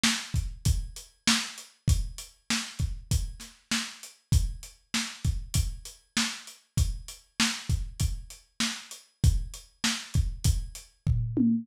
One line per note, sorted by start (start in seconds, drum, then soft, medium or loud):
0.03 snare loud
0.34 kick medium
0.34 closed hi-hat medium
0.65 kick medium
0.65 closed hi-hat medium
0.96 closed hi-hat medium
1.27 snare loud
1.58 closed hi-hat medium
1.88 kick medium
1.88 closed hi-hat medium
2.18 closed hi-hat medium
2.50 snare medium
2.79 kick medium
2.79 closed hi-hat medium
3.11 kick medium
3.11 closed hi-hat medium
3.40 snare soft
3.40 closed hi-hat medium
3.71 snare medium
4.03 closed hi-hat medium
4.32 kick medium
4.32 closed hi-hat medium
4.63 closed hi-hat medium
4.94 snare medium
5.24 kick medium
5.24 closed hi-hat medium
5.54 kick medium
5.54 closed hi-hat loud
5.85 closed hi-hat medium
6.17 snare medium
6.47 closed hi-hat medium
6.77 kick medium
6.77 closed hi-hat medium
7.08 closed hi-hat medium
7.40 snare loud
7.70 kick medium
7.70 closed hi-hat medium
8.00 kick medium
8.00 closed hi-hat medium
8.30 closed hi-hat medium
8.60 snare medium
8.91 closed hi-hat medium
9.24 kick medium
9.24 closed hi-hat medium
9.54 closed hi-hat medium
9.84 snare medium
10.14 kick medium
10.14 closed hi-hat medium
10.44 kick medium
10.44 closed hi-hat loud
10.75 closed hi-hat medium
11.07 kick medium
11.07 floor tom medium
11.37 high tom medium